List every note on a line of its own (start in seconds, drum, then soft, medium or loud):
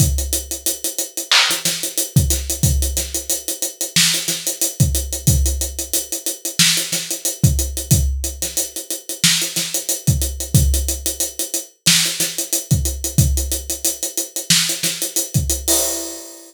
0.00 kick medium
0.00 closed hi-hat medium
0.18 closed hi-hat medium
0.33 closed hi-hat medium
0.51 closed hi-hat medium
0.66 closed hi-hat medium
0.84 closed hi-hat medium
0.98 closed hi-hat medium
1.17 closed hi-hat medium
1.31 clap loud
1.50 snare soft
1.50 closed hi-hat medium
1.65 snare medium
1.65 closed hi-hat medium
1.83 closed hi-hat medium
1.98 closed hi-hat medium
2.16 kick medium
2.16 closed hi-hat medium
2.30 snare soft
2.30 closed hi-hat medium
2.50 closed hi-hat medium
2.63 kick medium
2.63 closed hi-hat medium
2.82 closed hi-hat medium
2.97 snare soft
2.97 closed hi-hat medium
3.15 closed hi-hat medium
3.30 closed hi-hat medium
3.48 closed hi-hat medium
3.62 closed hi-hat medium
3.81 closed hi-hat medium
3.96 snare medium
4.14 closed hi-hat medium
4.28 snare soft
4.28 closed hi-hat medium
4.47 closed hi-hat medium
4.62 closed hi-hat medium
4.80 kick medium
4.80 closed hi-hat medium
4.95 closed hi-hat medium
5.13 closed hi-hat medium
5.27 kick medium
5.27 closed hi-hat loud
5.46 closed hi-hat medium
5.61 closed hi-hat medium
5.79 closed hi-hat medium
5.93 closed hi-hat medium
6.12 closed hi-hat medium
6.26 closed hi-hat medium
6.45 closed hi-hat medium
6.59 snare medium
6.77 closed hi-hat medium
6.92 snare soft
6.92 closed hi-hat medium
7.11 closed hi-hat medium
7.25 closed hi-hat medium
7.44 kick medium
7.44 closed hi-hat medium
7.59 closed hi-hat medium
7.77 closed hi-hat medium
7.91 kick medium
7.91 closed hi-hat medium
8.24 closed hi-hat medium
8.42 snare soft
8.42 closed hi-hat medium
8.57 closed hi-hat medium
8.76 closed hi-hat medium
8.91 closed hi-hat medium
9.09 closed hi-hat medium
9.24 snare medium
9.42 closed hi-hat medium
9.56 snare soft
9.56 closed hi-hat medium
9.74 closed hi-hat medium
9.89 closed hi-hat medium
10.07 kick medium
10.07 closed hi-hat medium
10.22 closed hi-hat medium
10.40 closed hi-hat medium
10.55 kick medium
10.55 closed hi-hat medium
10.74 closed hi-hat medium
10.88 closed hi-hat medium
11.06 closed hi-hat medium
11.20 closed hi-hat medium
11.39 closed hi-hat medium
11.54 closed hi-hat medium
11.86 snare loud
11.86 closed hi-hat medium
12.05 closed hi-hat medium
12.20 snare soft
12.20 closed hi-hat medium
12.38 closed hi-hat medium
12.53 closed hi-hat medium
12.71 kick medium
12.71 closed hi-hat medium
12.85 closed hi-hat medium
13.04 closed hi-hat medium
13.18 kick medium
13.18 closed hi-hat medium
13.37 closed hi-hat medium
13.52 closed hi-hat medium
13.70 closed hi-hat medium
13.85 closed hi-hat medium
14.03 closed hi-hat medium
14.17 closed hi-hat medium
14.36 closed hi-hat medium
14.50 snare medium
14.69 closed hi-hat medium
14.83 snare soft
14.83 closed hi-hat medium
15.02 closed hi-hat medium
15.16 closed hi-hat medium
15.34 kick medium
15.34 closed hi-hat medium
15.50 closed hi-hat medium
15.68 open hi-hat medium